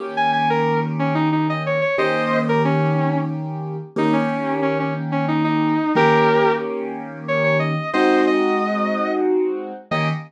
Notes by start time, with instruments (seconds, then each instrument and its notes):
0.00 acoustic grand piano D#3 A#3 C#4 G4
0.17 distortion guitar G#5
0.33 distortion guitar G#5
0.50 distortion guitar A#4
0.99 distortion guitar C#4
1.15 distortion guitar D#4
1.32 distortion guitar D#4
1.50 distortion guitar D#5
1.66 distortion guitar C#5
1.81 distortion guitar C#5
1.98 acoustic grand piano D#3 A#3 C#4 G4, distortion guitar C5 D#5
2.49 distortion guitar A#4
2.65 distortion guitar C#4
3.96 acoustic grand piano D#3 A#3 C#4 G4, distortion guitar D#4
4.13 distortion guitar C#4
4.62 distortion guitar C#4
4.80 distortion guitar C#4
5.12 distortion guitar C#4
5.28 distortion guitar D#4
5.44 distortion guitar D#4
5.95 acoustic grand piano D#3 A#3 C#4 G4, distortion guitar G4 A#4
7.28 distortion guitar C#5
7.44 distortion guitar C#5
7.59 distortion guitar D#5
7.93 acoustic grand piano G#3 C4 D#4 F#4, distortion guitar C5 D#5
8.27 distortion guitar D#5
9.91 acoustic grand piano D#3 A#3 C#4 G4, distortion guitar D#5